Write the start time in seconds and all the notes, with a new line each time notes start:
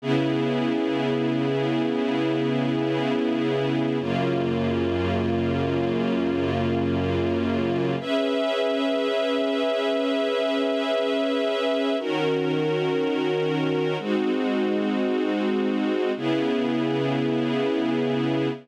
0.02 C#3 B3 E4 G#4
3.99 F#2 C#3 A#3 F4
8.00 C#4 G#4 B4 E5
11.99 D#3 C#4 F#4 A#4
13.99 G#3 C4 D#4 F#4
16.17 C#3 B3 E4 G#4